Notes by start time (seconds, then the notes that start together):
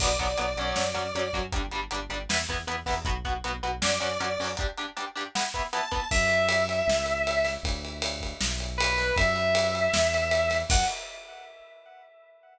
0.00 B1 F#3 B3 D5, kick, crash
0.19 B1 F#3 B3, kick, closed hi-hat
0.38 B1 F#3 B3, closed hi-hat
0.57 B1 F#3 C#4, closed hi-hat
0.76 F#2, snare
0.94 F#2 F#3 C#4, closed hi-hat
1.14 F#2 F#3 C#4, closed hi-hat
1.33 F#2 F#3 C#4, kick, closed hi-hat
1.52 G1 G3 D4, kick, closed hi-hat
1.71 G1 G3 D4, closed hi-hat
1.91 G1 G3 D4, closed hi-hat
2.09 G1 G3 D4, closed hi-hat
2.29 E2 B3 E4, snare
2.49 E2 B3 E4, kick, closed hi-hat
2.67 E2 B3 E4, closed hi-hat
2.86 E2 B3 E4, kick, open hi-hat
3.05 B1 B3 F#4, kick, closed hi-hat
3.25 B1 B3 F#4, kick, closed hi-hat
3.44 B1 B3 F#4, closed hi-hat
3.63 B1 B3 F#4, closed hi-hat
3.82 F#2 C#4 F#4 D5, snare
4.00 F#2 C#4 F#4, closed hi-hat
4.20 F#2 C#4 F#4, closed hi-hat
4.39 F#2 C#4 F#4, open hi-hat
4.57 D4 G4, kick, closed hi-hat
4.78 D4 G4, closed hi-hat
4.97 D4 G4, closed hi-hat
5.16 D4 G4, closed hi-hat
5.35 B3 E4, snare
5.54 B3 E4, kick, closed hi-hat
5.73 B3 E4 A5, closed hi-hat
5.92 B3 E4, kick, closed hi-hat
6.11 F#2 E5, kick, crash
6.30 ride
6.49 ride
6.69 ride
6.87 C#2, snare
7.06 ride
7.27 ride
7.45 snare, ride
7.63 D2, kick, ride
7.85 ride
8.02 ride
8.21 kick, ride
8.41 B1, snare
8.60 ride
8.78 B4, ride
8.98 snare, ride
9.16 F#2 E5, kick, ride
9.36 ride
9.55 ride
9.75 ride
9.94 E2, snare
10.14 ride
10.31 ride
10.50 snare, ride
10.70 F#2 F#5, kick, crash